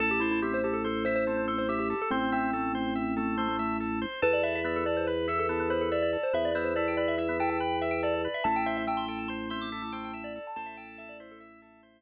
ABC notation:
X:1
M:5/4
L:1/16
Q:1/4=142
K:Am
V:1 name="Tubular Bells"
A G E E G c G A A2 c c3 A c G G2 A | C2 C10 z8 | B d e e d A d c B2 A A3 c A d d2 c | e d c c d g d e e2 g g3 e g d d2 e |
a g e e g c' g a c'2 c' d'3 g g a d2 a | a e g z e d c A e6 z6 |]
V:2 name="Drawbar Organ"
A4 C2 z4 E2 C C C2 z4 | C4 A,2 z4 A,2 A, A, A,2 z4 | A4 B,2 z4 E2 B, B, B,2 z4 | B,2 B,2 E4 E B, E2 z8 |
E4 A,2 z4 C2 E A, A,2 z4 | A6 E4 z10 |]
V:3 name="Drawbar Organ"
A2 c2 e2 A2 c2 e2 A2 c2 e2 A2 | c2 e2 A2 c2 e2 A2 c2 e2 A2 c2 | A2 B2 e2 A2 B2 e2 A2 B2 e2 A2 | B2 e2 A2 B2 e2 A2 B2 e2 A2 B2 |
A2 c2 e2 A2 c2 e2 A2 c2 e2 A2 | c2 e2 A2 c2 e2 A2 c2 z6 |]
V:4 name="Drawbar Organ" clef=bass
A,,,20 | A,,,20 | E,,20 | E,,20 |
A,,,20 | A,,,20 |]